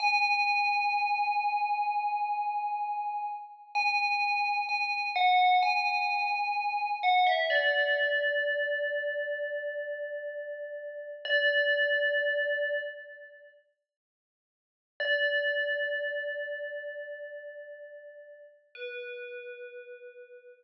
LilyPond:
\new Staff { \time 4/4 \key b \dorian \tempo 4 = 64 gis''1 | gis''4 gis''8 fis''8 gis''4. fis''16 e''16 | d''1 | d''2 r2 |
d''1 | b'2 r2 | }